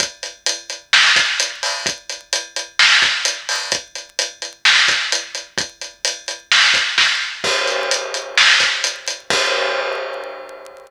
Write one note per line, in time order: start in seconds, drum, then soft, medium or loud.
0.00 kick medium
0.00 closed hi-hat loud
0.23 closed hi-hat medium
0.46 closed hi-hat loud
0.70 closed hi-hat medium
0.93 snare medium
1.16 kick medium
1.16 snare medium
1.16 closed hi-hat medium
1.40 closed hi-hat loud
1.63 open hi-hat medium
1.86 kick medium
1.86 closed hi-hat medium
2.09 closed hi-hat medium
2.33 closed hi-hat medium
2.56 closed hi-hat medium
2.79 snare medium
3.02 kick medium
3.02 snare medium
3.02 closed hi-hat medium
3.25 closed hi-hat loud
3.49 open hi-hat medium
3.72 kick medium
3.72 closed hi-hat medium
3.95 closed hi-hat medium
4.19 closed hi-hat medium
4.42 closed hi-hat medium
4.65 snare medium
4.88 kick medium
4.88 snare soft
4.88 closed hi-hat medium
5.12 closed hi-hat medium
5.35 closed hi-hat medium
5.58 kick loud
5.58 closed hi-hat medium
5.81 closed hi-hat medium
6.05 closed hi-hat loud
6.28 closed hi-hat medium
6.52 snare medium
6.74 kick medium
6.74 snare soft
6.74 closed hi-hat medium
6.98 kick medium
6.98 snare medium
7.44 kick medium
7.44 crash medium
7.67 closed hi-hat medium
7.91 closed hi-hat medium
8.14 closed hi-hat medium
8.37 snare medium
8.60 kick medium
8.60 snare soft
8.60 closed hi-hat medium
8.84 closed hi-hat medium
9.08 closed hi-hat medium
9.30 kick loud
9.30 crash loud